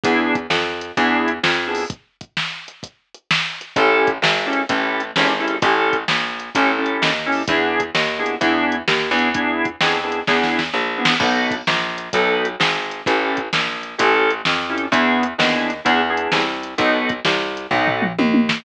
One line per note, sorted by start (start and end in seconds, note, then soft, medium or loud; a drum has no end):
0.03 0.47 E2 medium
0.03 0.36 B3 medium
0.03 0.36 D4 medium
0.03 0.36 E4 medium
0.03 0.36 G#4 medium
0.03 kick loud
0.03 closed hi-hat loud
0.35 kick medium
0.35 closed hi-hat medium
0.50 0.92 F2 medium
0.50 snare medium
0.81 closed hi-hat medium
0.97 1.39 E2 medium
0.97 1.30 B3 medium
0.97 1.30 D4 medium
0.97 1.30 E4 medium
0.97 1.30 G#4 medium
0.97 kick medium
0.97 closed hi-hat medium
1.28 closed hi-hat medium
1.43 1.85 F2 medium
1.43 snare loud
1.67 1.84 B3 medium
1.67 1.84 D4 medium
1.67 1.84 E4 medium
1.67 1.84 G#4 medium
1.75 open hi-hat medium
1.90 kick loud
1.90 closed hi-hat medium
2.21 kick medium
2.21 closed hi-hat medium
2.37 snare medium
2.68 closed hi-hat medium
2.83 kick medium
2.83 closed hi-hat medium
3.14 closed hi-hat medium
3.31 snare loud
3.61 closed hi-hat medium
3.76 4.18 A1 medium
3.76 4.10 C#4 medium
3.76 4.10 E4 medium
3.76 4.10 G4 medium
3.76 4.10 A4 medium
3.76 kick loud
3.76 closed hi-hat medium
4.07 kick medium
4.07 closed hi-hat medium
4.22 4.64 G#1 medium
4.22 snare loud
4.46 4.62 C#4 medium
4.46 4.62 E4 medium
4.46 4.62 G4 medium
4.46 4.62 A4 medium
4.53 closed hi-hat medium
4.69 5.12 A1 medium
4.69 5.01 C#4 medium
4.69 5.01 E4 medium
4.69 5.01 G4 medium
4.69 5.01 A4 medium
4.69 kick medium
4.69 closed hi-hat loud
5.00 closed hi-hat medium
5.16 5.58 G#1 medium
5.16 5.32 C#4 medium
5.16 5.32 E4 medium
5.16 5.32 G4 medium
5.16 5.32 A4 medium
5.16 snare loud
5.40 5.56 C#4 medium
5.40 5.56 E4 medium
5.40 5.56 G4 medium
5.40 5.56 A4 medium
5.48 closed hi-hat medium
5.62 6.04 A1 medium
5.62 5.96 C#4 medium
5.62 5.96 E4 medium
5.62 5.96 G4 medium
5.62 5.96 A4 medium
5.62 kick loud
5.62 closed hi-hat loud
5.93 kick medium
5.93 closed hi-hat medium
6.08 6.50 A#1 medium
6.08 snare loud
6.40 closed hi-hat medium
6.55 6.97 A1 medium
6.55 6.71 C#4 medium
6.55 6.71 E4 medium
6.55 6.71 G4 medium
6.55 6.71 A4 medium
6.55 kick medium
6.55 closed hi-hat loud
6.78 7.11 C#4 medium
6.78 7.11 E4 medium
6.78 7.11 G4 medium
6.78 7.11 A4 medium
6.86 closed hi-hat medium
7.02 7.44 D#2 medium
7.02 snare loud
7.26 7.42 C#4 medium
7.26 7.42 E4 medium
7.26 7.42 G4 medium
7.26 7.42 A4 medium
7.32 open hi-hat medium
7.48 7.91 E2 medium
7.48 7.81 B3 medium
7.48 7.81 D4 medium
7.48 7.81 E4 medium
7.48 7.81 G#4 medium
7.48 kick loud
7.48 closed hi-hat loud
7.80 kick medium
7.80 closed hi-hat medium
7.95 8.36 D#2 medium
7.95 snare loud
8.19 8.35 B3 medium
8.19 8.35 D4 medium
8.19 8.35 E4 medium
8.19 8.35 G#4 medium
8.26 closed hi-hat medium
8.41 8.83 E2 medium
8.41 8.75 B3 medium
8.41 8.75 D4 medium
8.41 8.75 E4 medium
8.41 8.75 G#4 medium
8.41 kick medium
8.41 closed hi-hat medium
8.72 closed hi-hat medium
8.88 9.10 D#2 medium
8.88 snare loud
9.11 9.76 E2 medium
9.11 9.29 B3 medium
9.11 9.29 D4 medium
9.11 9.29 E4 medium
9.11 9.29 G#4 medium
9.19 closed hi-hat medium
9.34 9.67 B3 medium
9.34 9.67 D4 medium
9.34 9.67 E4 medium
9.34 9.67 G#4 medium
9.34 kick medium
9.34 closed hi-hat medium
9.65 kick medium
9.65 closed hi-hat medium
9.81 10.22 F2 medium
9.81 9.98 B3 medium
9.81 9.98 D4 medium
9.81 9.98 E4 medium
9.81 9.98 G#4 medium
9.81 snare loud
10.03 10.20 B3 medium
10.03 10.20 D4 medium
10.03 10.20 E4 medium
10.03 10.20 G#4 medium
10.12 closed hi-hat medium
10.27 10.70 E2 medium
10.27 10.60 B3 medium
10.27 10.60 D4 medium
10.27 10.60 E4 medium
10.27 10.60 G#4 medium
10.27 kick medium
10.27 snare medium
10.43 snare medium
10.59 snare medium
10.73 11.15 A#1 medium
10.97 11.14 B3 medium
10.97 11.14 D4 medium
10.97 11.14 E4 medium
10.97 11.14 G#4 medium
11.05 snare loud
11.20 11.62 B1 medium
11.20 11.54 B3 medium
11.20 11.54 D#4 medium
11.20 11.54 F#4 medium
11.20 11.54 A4 medium
11.20 kick loud
11.20 crash loud
11.51 kick medium
11.51 closed hi-hat medium
11.67 12.09 A#1 medium
11.67 snare loud
11.98 closed hi-hat medium
12.13 12.56 B1 medium
12.13 12.46 B3 medium
12.13 12.46 D#4 medium
12.13 12.46 F#4 medium
12.13 12.46 A4 medium
12.13 kick medium
12.13 closed hi-hat loud
12.45 closed hi-hat medium
12.60 13.02 G#1 medium
12.60 snare loud
12.91 closed hi-hat medium
13.06 13.49 A1 medium
13.06 13.39 C#4 medium
13.06 13.39 E4 medium
13.06 13.39 G4 medium
13.06 13.39 A4 medium
13.06 kick loud
13.06 closed hi-hat medium
13.37 kick medium
13.37 closed hi-hat medium
13.53 13.95 A#1 medium
13.53 snare loud
13.83 closed hi-hat medium
13.98 14.42 A1 medium
13.98 14.31 C#4 medium
13.98 14.31 E4 medium
13.98 14.31 G4 medium
13.98 14.31 A4 medium
13.98 kick medium
13.98 closed hi-hat loud
14.30 closed hi-hat medium
14.45 14.88 F2 medium
14.45 snare loud
14.69 14.86 C#4 medium
14.69 14.86 E4 medium
14.69 14.86 G4 medium
14.69 14.86 A4 medium
14.78 closed hi-hat medium
14.91 15.34 E2 medium
14.91 15.24 B3 medium
14.91 15.24 D4 medium
14.91 15.24 E4 medium
14.91 15.24 G#4 medium
14.91 kick medium
14.91 closed hi-hat medium
15.23 closed hi-hat medium
15.38 15.81 D#2 medium
15.38 15.71 B3 medium
15.38 15.71 D4 medium
15.38 15.71 E4 medium
15.38 15.71 G#4 medium
15.38 snare loud
15.70 closed hi-hat medium
15.85 16.28 E2 medium
15.85 16.01 B3 medium
15.85 16.01 D4 medium
15.85 16.01 E4 medium
15.85 16.01 G#4 medium
15.85 kick medium
15.85 closed hi-hat medium
16.09 16.42 B3 medium
16.09 16.42 D4 medium
16.09 16.42 E4 medium
16.09 16.42 G#4 medium
16.17 closed hi-hat medium
16.32 16.75 C2 medium
16.32 snare loud
16.63 closed hi-hat medium
16.78 17.20 B1 medium
16.78 17.10 B3 medium
16.78 17.10 D#4 medium
16.78 17.10 F#4 medium
16.78 17.10 A4 medium
16.78 kick medium
16.78 closed hi-hat medium
17.09 kick medium
17.09 closed hi-hat medium
17.25 17.67 C2 medium
17.25 snare loud
17.57 closed hi-hat medium
17.71 18.13 B1 medium
17.71 18.04 B3 medium
17.71 18.04 D#4 medium
17.71 18.04 F#4 medium
17.71 18.04 A4 medium
17.71 kick medium
17.71 floor tom medium
17.87 floor tom medium
18.02 mid tom medium
18.19 18.60 D#2 medium
18.19 high tom medium
18.34 high tom medium
18.49 snare loud